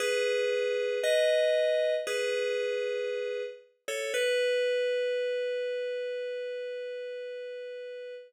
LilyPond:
\new Staff { \time 4/4 \key b \mixolydian \tempo 4 = 58 <gis' b'>4 <b' dis''>4 <gis' b'>4. r16 <a' cis''>16 | b'1 | }